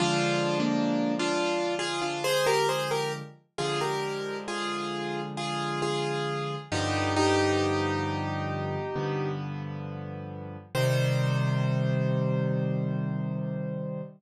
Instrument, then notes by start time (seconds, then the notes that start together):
acoustic grand piano
0.00 D3 F3 G#3 D4 F4
0.60 A#3 D4
1.19 D4 F4
1.79 F4 G#4
2.02 D4 F4
2.24 G#4 C5
2.46 G4 A#4
2.69 G#4 C5
2.91 G4 A#4
3.58 D3 F3 G#3 F4 G#4
3.81 G4 A#4
4.48 F4 G#4
5.37 F4 G#4
5.82 F4 G#4
6.72 G2 D3 F3 B3 D#4 G4
7.16 D#4 G4
8.96 G2 D3 F3 B3
10.75 C3 D#3 G3 C5